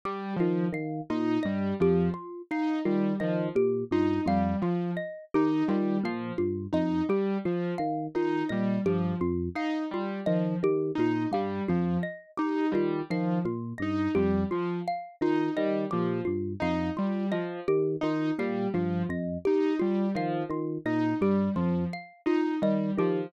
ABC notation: X:1
M:6/8
L:1/8
Q:3/8=57
K:none
V:1 name="Electric Piano 1" clef=bass
z ^D, D, ^A,, G,, F,, | z2 ^D, D, ^A,, G,, | F,, z2 ^D, D, ^A,, | G,, F,, z2 ^D, D, |
^A,, G,, F,, z2 ^D, | ^D, ^A,, G,, F,, z2 | ^D, D, ^A,, G,, F,, z | z ^D, D, ^A,, G,, F,, |
z2 ^D, D, ^A,, G,, | F,, z2 ^D, D, ^A,, | G,, F,, z2 ^D, D, |]
V:2 name="Acoustic Grand Piano"
G, F, z ^D G, F, | z ^D G, F, z D | G, F, z ^D G, F, | z ^D G, F, z D |
G, F, z ^D G, F, | z ^D G, F, z D | G, F, z ^D G, F, | z ^D G, F, z D |
G, F, z ^D G, F, | z ^D G, F, z D | G, F, z ^D G, F, |]
V:3 name="Xylophone"
G F f F ^d G | F f F ^d G F | f F ^d G F f | F ^d G F f F |
^d G F f F d | G F f F ^d G | F f F ^d G F | f F ^d G F f |
F ^d G F f F | ^d G F f F d | G F f F ^d G |]